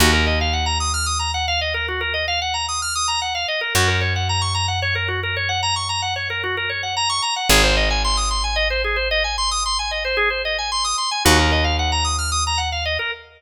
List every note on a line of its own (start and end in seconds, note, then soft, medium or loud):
0.00 3.45 D#2 loud
0.00 0.11 F#4 loud
0.13 0.25 A#4 medium
0.27 0.39 D#5 medium
0.41 0.53 F5 medium
0.53 0.65 F#5 medium
0.66 0.78 A#5 medium
0.80 0.92 D#6 medium
0.94 1.06 F6 medium
1.06 1.18 D#6 medium
1.19 1.31 A#5 medium
1.34 1.46 F#5 medium
1.48 1.60 F5 loud
1.61 1.73 D#5 medium
1.74 1.86 A#4 medium
1.88 2.00 F#4 medium
2.01 2.13 A#4 medium
2.14 2.26 D#5 medium
2.28 2.40 F5 loud
2.42 2.54 F#5 medium
2.54 2.66 A#5 medium
2.69 2.81 D#6 medium
2.82 2.94 F6 medium
2.95 3.07 D#6 medium
3.08 3.20 A#5 medium
3.22 3.34 F#5 medium
3.35 3.47 F5 medium
3.48 3.60 D#5 medium
3.61 3.73 A#4 medium
3.75 7.20 F#2 loud
3.75 3.87 F#4 loud
3.88 4.00 A#4 medium
4.01 4.13 C#5 medium
4.16 4.28 F#5 medium
4.29 4.41 A#5 medium
4.42 4.54 C#6 medium
4.54 4.66 A#5 medium
4.68 4.80 F#5 medium
4.82 4.94 C#5 loud
4.95 5.07 A#4 medium
5.08 5.20 F#4 medium
5.23 5.35 A#4 medium
5.37 5.49 C#5 medium
5.49 5.61 F#5 medium
5.63 5.75 A#5 loud
5.76 5.88 C#6 medium
5.89 6.01 A#5 medium
6.02 6.14 F#5 medium
6.16 6.28 C#5 medium
6.30 6.42 A#4 medium
6.44 6.56 F#4 medium
6.57 6.69 A#4 medium
6.70 6.82 C#5 medium
6.83 6.95 F#5 medium
6.97 7.09 A#5 loud
7.09 7.22 C#6 loud
7.22 7.34 A#5 medium
7.36 7.48 F#5 medium
7.49 10.94 G#1 loud
7.49 7.62 G#4 loud
7.64 7.76 C5 medium
7.77 7.89 D#5 medium
7.90 8.02 G#5 medium
8.04 8.17 C6 loud
8.17 8.29 D#6 medium
8.31 8.43 C6 medium
8.44 8.56 G#5 medium
8.56 8.68 D#5 loud
8.70 8.82 C5 medium
8.84 8.96 G#4 medium
8.96 9.08 C5 medium
9.11 9.23 D#5 loud
9.24 9.36 G#5 medium
9.38 9.50 C6 loud
9.51 9.63 D#6 medium
9.66 9.78 C6 medium
9.79 9.91 G#5 medium
9.91 10.03 D#5 medium
10.05 10.17 C5 medium
10.17 10.29 G#4 loud
10.30 10.42 C5 medium
10.45 10.57 D#5 medium
10.58 10.71 G#5 medium
10.72 10.84 C6 medium
10.84 10.96 D#6 medium
10.98 11.10 C6 medium
11.11 11.23 G#5 medium
11.25 12.98 D#2 loud
11.25 11.37 F#4 loud
11.39 11.51 A#4 medium
11.52 11.64 D#5 medium
11.64 11.76 F5 medium
11.79 11.91 F#5 medium
11.92 12.04 A#5 medium
12.04 12.17 D#6 medium
12.18 12.30 F6 medium
12.32 12.44 D#6 medium
12.47 12.59 A#5 medium
12.58 12.70 F#5 medium
12.72 12.84 F5 medium
12.85 12.98 D#5 medium
12.99 13.11 A#4 medium